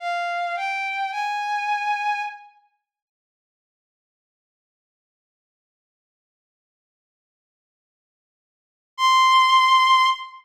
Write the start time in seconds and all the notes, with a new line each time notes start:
0.00 F5
0.56 G5
1.12 G#5
8.97 C6